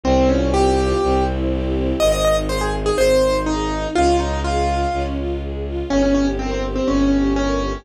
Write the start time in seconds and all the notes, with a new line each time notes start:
0.04 C2 C4
0.29 C#4 F4
0.54 G4
0.78 F4
1.03 C2 C4
1.27 E4
1.51 G4
1.76 E4
2.00 G#1 C4 D#5
2.12 D#5
2.25 D#4 D#5
2.49 G#4 C5
2.61 G#4
2.73 D#4
2.86 G#4
2.97 G#1 C4 C5
3.22 D#4
3.46 D#4 G#4
3.71 D#4
3.95 C#2 C#4 F4
4.19 D#4 F4
4.44 F4 G#4
4.68 F4
4.93 C#2 C#4
5.17 F4
5.42 G#4
5.66 F4
5.90 G1 C#4
6.03 C#4
6.15 C#4 G4
6.39 C4 A#4
6.51 C4
6.64 G4
6.76 C4
6.87 G1 C#4
7.12 G4
7.36 C#4 A#4
7.61 G4